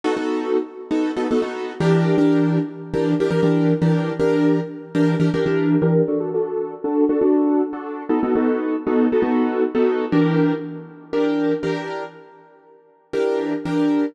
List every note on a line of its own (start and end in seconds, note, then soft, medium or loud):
0.04 0.14 B3 medium
0.04 0.14 D#4 medium
0.04 0.14 F#4 loud
0.04 0.14 A4 medium
0.17 0.57 B3 medium
0.17 0.57 D#4 medium
0.17 0.57 F#4 medium
0.17 0.57 A4 medium
0.91 1.11 B3 medium
0.91 1.11 D#4 medium
0.91 1.11 F#4 medium
0.91 1.11 A4 medium
1.16 1.27 B3 medium
1.16 1.27 D#4 medium
1.16 1.27 F#4 medium
1.16 1.27 A4 medium
1.31 1.41 B3 medium
1.31 1.41 D#4 medium
1.31 1.41 F#4 medium
1.31 1.41 A4 medium
1.42 1.72 B3 medium
1.42 1.72 D#4 medium
1.42 1.72 F#4 medium
1.42 1.72 A4 medium
1.80 2.16 E3 medium
1.80 2.16 D4 loud
1.80 2.16 G4 loud
1.80 2.16 A#4 medium
2.18 2.58 E3 medium
2.18 2.58 D4 medium
2.18 2.58 G4 medium
2.18 2.58 A#4 medium
2.94 3.14 E3 medium
2.94 3.14 D4 medium
2.94 3.14 G4 medium
2.94 3.14 A#4 medium
3.20 3.30 E3 medium
3.20 3.30 D4 medium
3.20 3.30 G4 medium
3.20 3.30 A#4 medium
3.31 3.41 E3 medium
3.31 3.41 D4 medium
3.31 3.41 G4 medium
3.31 3.41 A#4 medium
3.43 3.73 E3 medium
3.43 3.73 D4 medium
3.43 3.73 G4 medium
3.43 3.73 A#4 medium
3.82 4.12 E3 medium
3.82 4.12 D4 medium
3.82 4.12 G4 medium
3.82 4.12 A#4 medium
4.20 4.60 E3 medium
4.20 4.60 D4 medium
4.20 4.60 G4 medium
4.20 4.60 A#4 medium
4.95 5.15 E3 medium
4.95 5.15 D4 medium
4.95 5.15 G4 medium
4.95 5.15 A#4 medium
5.20 5.30 E3 medium
5.20 5.30 D4 medium
5.20 5.30 G4 medium
5.20 5.30 A#4 medium
5.34 5.44 E3 medium
5.34 5.44 D4 medium
5.34 5.44 G4 medium
5.34 5.44 A#4 medium
5.46 5.76 E3 medium
5.46 5.76 D4 medium
5.46 5.76 G4 medium
5.46 5.76 A#4 medium
5.82 6.02 E3 medium
5.82 6.02 D4 medium
5.82 6.02 G4 medium
5.82 6.02 A#4 medium
6.08 6.18 D4 medium
6.08 6.18 F#4 medium
6.08 6.18 A4 medium
6.20 6.30 D4 medium
6.20 6.30 F#4 medium
6.20 6.30 A4 medium
6.34 6.74 D4 medium
6.34 6.74 F#4 medium
6.34 6.74 A4 medium
6.84 7.04 D4 medium
6.84 7.04 F#4 medium
6.84 7.04 A4 medium
7.09 7.19 D4 medium
7.09 7.19 F#4 medium
7.09 7.19 A4 medium
7.21 7.62 D4 medium
7.21 7.62 F#4 medium
7.21 7.62 A4 medium
7.73 8.03 D4 medium
7.73 8.03 F#4 medium
7.73 8.03 A4 medium
8.09 8.19 B3 medium
8.09 8.19 D#4 medium
8.09 8.19 F#4 medium
8.09 8.19 A4 medium
8.23 8.33 B3 medium
8.23 8.33 D#4 medium
8.23 8.33 F#4 medium
8.23 8.33 A4 medium
8.36 8.76 B3 medium
8.36 8.76 D#4 medium
8.36 8.76 F#4 medium
8.36 8.76 A4 medium
8.87 9.07 B3 medium
8.87 9.07 D#4 medium
8.87 9.07 F#4 medium
8.87 9.07 A4 medium
9.12 9.22 B3 medium
9.12 9.22 D#4 medium
9.12 9.22 F#4 medium
9.12 9.22 A4 medium
9.22 9.63 B3 medium
9.22 9.63 D#4 medium
9.22 9.63 F#4 medium
9.22 9.63 A4 medium
9.75 10.05 B3 medium
9.75 10.05 D#4 medium
9.75 10.05 F#4 medium
9.75 10.05 A4 medium
10.12 10.53 E3 medium
10.12 10.53 D4 medium
10.12 10.53 G4 medium
10.12 10.53 A#4 medium
11.13 11.53 E3 medium
11.13 11.53 D4 medium
11.13 11.53 G4 medium
11.13 11.53 A#4 medium
11.63 12.03 E3 medium
11.63 12.03 D4 medium
11.63 12.03 G4 medium
11.63 12.03 A#4 medium
13.13 13.54 E3 medium
13.13 13.54 D4 medium
13.13 13.54 G4 medium
13.13 13.54 A#4 medium
13.65 14.06 E3 medium
13.65 14.06 D4 medium
13.65 14.06 G4 medium
13.65 14.06 A#4 medium